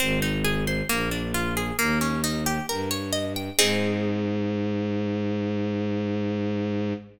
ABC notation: X:1
M:4/4
L:1/16
Q:1/4=67
K:Ab
V:1 name="Orchestral Harp"
C E A c B, =D F A B, _D E G B d e g | [CEA]16 |]
V:2 name="Violin" clef=bass
A,,,4 B,,,4 E,,4 G,,4 | A,,16 |]